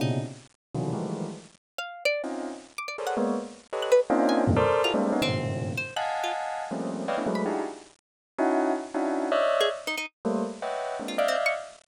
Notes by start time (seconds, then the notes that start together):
0.00 A#2 B2 C3 C#3 D#4
0.74 B2 C3 D3 D#3 E3 F#3
0.93 D#3 E3 F3 G3 G#3 A3
1.78 F5
2.05 D5
2.24 C4 C#4 D#4 F4
2.78 D6
2.88 D5
2.98 G#4 A4 A#4 C5 C#5 D5
3.07 F#5
3.17 G#3 A#3 B3
3.73 G4 A4 B4 C#5 D#5
3.82 F#6
3.92 B4
4.10 A#3 C4 C#4 D4 D#4 F4
4.29 G#5
4.47 E2 F#2 G2 A2 A#2 C3
4.56 A4 A#4 C5 D5
4.84 E4 F4 F#4 G#4 A4 A#4
4.94 G3 G#3 A3 A#3 C4 D4
5.12 B3 C#4 D#4
5.22 G2 G#2 A#2 B2 C#3 D#3 C4
5.77 C5
5.96 D#5 F5 F#5 G#5 A5 F#6
6.24 F4
6.71 F3 G3 A3 A#3 C4 C#4
7.08 B4 C#5 D5 D#5 F5 G5
7.17 A3 B3 C#4 D4 E4
7.27 F#3 G#3 A3
7.35 B5
7.45 D4 D#4 E4 F#4 G4 G#4
8.38 C#4 D#4 E4 F#4
8.94 C#4 D4 D#4 E4 F#4
9.32 C#5 D5 D#5 E5
9.61 G#4
9.87 D#4
9.97 D#4
10.25 G3 A3 A#3
10.62 B4 C#5 D#5 E5 F#5 G5
11.00 G#3 A#3 C4 D4
11.08 F4
11.18 D5 D#5 E5 F5
11.28 C4
11.46 C#6